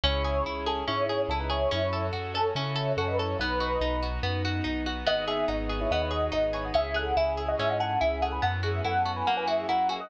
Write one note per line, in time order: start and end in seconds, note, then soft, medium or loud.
0.03 0.41 C#2 loud
0.03 1.70 C#4 medium
0.03 0.23 C#4 medium
0.03 1.70 E4 medium
0.03 0.44 E4 medium
0.03 1.70 G#4 medium
0.03 0.44 C#5 loud
0.24 0.43 G#4 medium
0.45 0.83 C#2 medium
0.45 0.65 E4 medium
0.66 0.84 C#4 medium
0.66 0.85 G#4 medium
0.66 0.84 A4 medium
0.87 1.26 G#2 medium
0.87 1.06 C#4 medium
0.87 1.22 E4 medium
0.87 1.22 C#5 medium
1.09 1.28 G#4 medium
1.29 1.66 C#2 medium
1.29 1.39 C#4 medium
1.29 1.50 E4 medium
1.29 1.39 A4 medium
1.40 1.50 D#4 medium
1.40 1.50 B4 medium
1.50 1.71 E4 medium
1.50 1.69 G#4 medium
1.50 1.71 C#5 medium
1.71 2.10 F#2 medium
1.71 1.90 C#4 medium
1.71 3.37 C#4 medium
1.71 2.06 E4 medium
1.71 3.37 F#4 medium
1.71 3.37 A4 medium
1.71 2.06 C#5 medium
1.93 2.12 A4 medium
2.13 2.51 F#2 medium
2.13 2.32 F#4 medium
2.34 2.53 C#4 medium
2.34 2.53 A4 medium
2.34 2.54 A4 medium
2.55 2.93 C#3 medium
2.55 2.75 C#4 medium
2.55 2.92 E4 medium
2.55 2.92 C#5 medium
2.76 2.94 A4 medium
2.97 3.35 F#2 loud
2.97 3.07 C#4 medium
2.97 3.17 F#4 medium
2.97 3.07 A4 medium
3.08 3.18 D#4 medium
3.08 3.18 B4 medium
3.18 3.37 E4 medium
3.18 3.38 A4 medium
3.18 3.37 C#5 medium
3.39 3.77 B1 loud
3.39 5.05 B3 medium
3.39 3.60 B3 medium
3.39 5.05 D#4 medium
3.39 4.07 D#4 medium
3.39 5.05 F#4 medium
3.39 4.07 B4 medium
3.60 3.79 F#4 medium
3.81 4.19 B1 medium
3.81 4.00 D#4 medium
4.03 4.22 F#4 medium
4.23 4.61 F#2 loud
4.23 4.42 B3 medium
4.45 4.64 F#4 medium
4.64 5.03 B1 medium
4.64 4.83 D#4 medium
4.86 5.05 F#4 medium
5.06 5.44 G#1 loud
5.06 5.25 B3 medium
5.06 6.73 B3 loud
5.06 6.73 D#4 medium
5.06 5.24 F#4 medium
5.06 6.73 G#4 medium
5.06 5.24 D#5 loud
5.28 5.47 G#4 medium
5.28 5.45 G#4 medium
5.28 5.45 E5 medium
5.48 5.86 G#1 medium
5.48 5.67 D#4 medium
5.48 5.78 F#4 medium
5.48 5.78 D#5 medium
5.69 5.88 G#4 medium
5.81 5.90 E4 medium
5.81 5.90 C#5 medium
5.91 6.29 D#2 medium
5.91 6.11 B3 medium
5.91 6.01 F#4 medium
5.91 6.01 D#5 medium
6.01 6.11 E4 medium
6.01 6.11 C#5 medium
6.11 6.33 F#4 medium
6.11 6.30 G#4 medium
6.11 6.33 D#5 medium
6.32 6.71 G#1 medium
6.32 6.51 D#4 medium
6.32 6.53 F#4 medium
6.32 6.53 D#5 medium
6.53 6.64 E4 medium
6.53 6.72 G#4 medium
6.53 6.64 C#5 medium
6.64 6.74 F#4 medium
6.64 6.74 D#5 medium
6.74 7.13 C#2 loud
6.74 6.93 C#4 medium
6.74 8.41 C#4 medium
6.74 8.41 E4 medium
6.74 8.41 G#4 medium
6.74 6.94 G#4 medium
6.74 6.94 E5 loud
6.94 7.13 G#4 medium
6.94 7.15 A4 medium
6.94 7.15 F#5 medium
7.17 7.54 C#2 medium
7.17 7.36 E4 medium
7.17 7.45 G#4 medium
7.17 7.45 E5 medium
7.37 7.56 G#4 medium
7.48 7.58 F#4 medium
7.48 7.58 D#5 medium
7.59 7.97 G#2 loud
7.59 7.78 C#4 medium
7.59 7.69 G#4 medium
7.59 7.69 E5 medium
7.69 7.79 F#4 medium
7.69 7.79 D#5 medium
7.80 7.99 G#4 medium
7.80 7.99 A4 medium
7.80 7.99 F#5 medium
8.01 8.39 C#2 loud
8.01 8.20 E4 medium
8.01 8.21 G#4 medium
8.01 8.21 E5 medium
8.22 8.41 G#4 medium
8.22 8.32 A4 medium
8.22 8.32 F#5 medium
8.32 8.42 B4 medium
8.32 8.42 G#5 medium
8.42 8.81 F#2 loud
8.42 8.61 B3 medium
8.42 9.26 B3 medium
8.42 9.26 C#4 medium
8.42 9.26 E4 medium
8.42 9.26 F#4 medium
8.42 8.60 A4 medium
8.42 8.60 F#5 loud
8.63 8.82 F#4 medium
8.63 8.82 G#4 medium
8.63 8.82 E5 medium
8.85 9.22 F#2 medium
8.85 9.03 E4 medium
8.85 9.12 A4 medium
8.85 9.12 F#5 medium
9.06 9.24 F#4 medium
9.16 9.26 B4 medium
9.16 9.26 G#5 medium
9.27 9.65 F#2 loud
9.27 10.10 A#3 medium
9.27 9.46 A#3 medium
9.27 10.10 C#4 medium
9.27 10.10 E4 medium
9.27 10.10 F#4 medium
9.27 9.37 A#4 medium
9.27 9.37 F#5 medium
9.37 9.47 B4 medium
9.37 9.47 G#5 medium
9.47 9.66 F#4 medium
9.47 9.66 G#4 medium
9.47 9.66 E5 medium
9.69 10.07 F#2 medium
9.69 9.88 E4 medium
9.69 9.89 A#4 medium
9.69 9.89 F#5 medium
9.89 10.08 F#4 medium
9.89 10.00 G#4 medium
9.89 10.00 E5 medium
10.00 10.10 F#4 medium
10.00 10.10 D#5 loud